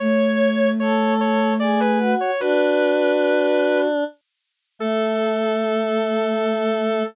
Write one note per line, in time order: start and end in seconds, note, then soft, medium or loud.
0.00 2.15 A3 loud
0.00 0.68 C#5 loud
0.00 0.71 C#5 loud
0.80 1.53 A4 medium
0.80 1.12 C#5 medium
1.21 1.53 C#5 loud
1.60 1.99 G#4 loud
1.60 1.79 D5 medium
1.80 2.12 B4 loud
1.99 2.31 F#4 loud
2.21 2.40 C#5 medium
2.40 4.04 D4 loud
2.40 3.87 F#4 loud
2.40 3.77 B4 loud
4.79 7.03 A3 loud
4.79 7.04 A4 loud